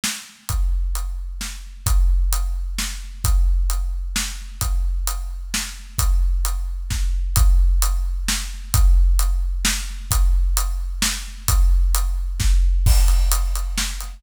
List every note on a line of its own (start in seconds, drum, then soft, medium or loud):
0.04 snare loud
0.49 kick medium
0.49 closed hi-hat medium
0.95 closed hi-hat medium
1.41 snare medium
1.86 kick loud
1.86 closed hi-hat loud
2.33 closed hi-hat loud
2.79 snare loud
3.24 kick loud
3.24 closed hi-hat loud
3.70 closed hi-hat medium
4.16 snare loud
4.61 kick medium
4.61 closed hi-hat loud
5.07 closed hi-hat loud
5.54 snare loud
5.98 kick loud
5.98 closed hi-hat loud
6.45 closed hi-hat loud
6.90 kick medium
6.90 snare medium
7.36 kick loud
7.36 closed hi-hat loud
7.82 closed hi-hat loud
8.28 snare loud
8.74 kick loud
8.74 closed hi-hat loud
9.19 closed hi-hat loud
9.65 snare loud
10.11 kick loud
10.11 closed hi-hat loud
10.57 closed hi-hat loud
11.02 snare loud
11.48 kick loud
11.48 closed hi-hat loud
11.95 closed hi-hat loud
12.40 kick loud
12.40 snare medium
12.86 kick loud
12.86 crash loud
13.08 closed hi-hat medium
13.32 closed hi-hat loud
13.55 closed hi-hat medium
13.78 snare loud
14.00 closed hi-hat medium